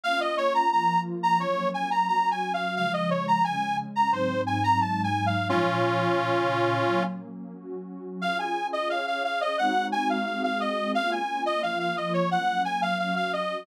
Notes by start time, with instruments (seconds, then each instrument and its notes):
0.04 pad 2 (warm) A#3 C#4 F4, accordion F5
0.20 accordion D#5
0.37 accordion C#5
0.54 accordion A#5
0.72 pad 2 (warm) F3 A#3 F4, accordion A#5
1.23 accordion A#5
1.40 pad 2 (warm) F#3 A#3 C#4, accordion C#5
1.74 accordion G#5
1.91 accordion A#5
2.08 pad 2 (warm) F#3 C#4 F#4, accordion A#5
2.31 accordion G#5
2.54 accordion F5
2.76 pad 2 (warm) C#3 F3 G#3, accordion F5
2.93 accordion D#5
3.10 accordion C#5
3.28 accordion A#5
3.44 pad 2 (warm) C#3 G#3 C#4, accordion G#5
3.96 accordion A#5
4.11 pad 2 (warm) G#2 F#3 C4 D#4, accordion C5
4.47 accordion G#5
4.64 accordion A#5
4.80 pad 2 (warm) G#2 F#3 G#3 D#4, accordion A5
5.04 accordion G#5
5.26 accordion F5
5.49 pad 2 (warm) A#2 F3 C#4, accordion C#4 F4
6.17 pad 2 (warm) A#2 C#3 C#4
6.84 pad 2 (warm) F#3 A#3 C#4
7.53 pad 2 (warm) F#3 C#4 F#4
8.22 pad 2 (warm) C#4 F4 G#4, accordion F5
8.39 accordion G#5
8.73 accordion D#5
8.90 pad 2 (warm) C#4 G#4 C#5, accordion F5
9.07 accordion F5
9.24 accordion F5
9.41 accordion D#5
9.58 pad 2 (warm) G#3 C4 D#4 F#4, accordion F#5
9.92 accordion G#5
10.10 accordion F5
10.26 pad 2 (warm) G#3 C4 F#4 G#4, accordion F5
10.44 accordion F5
10.60 accordion D#5
10.95 pad 2 (warm) A#3 C#4 F4, accordion F5
11.12 accordion G#5
11.46 accordion D#5
11.62 pad 2 (warm) F3 A#3 F4, accordion F5
11.80 accordion F5
11.97 accordion D#5
12.14 accordion C#5
12.30 pad 2 (warm) F#3 A#3 C#4, accordion F#5
12.65 accordion G#5
12.82 accordion F5
12.99 pad 2 (warm) F#3 C#4 F#4, accordion F5
13.16 accordion F5
13.33 accordion D#5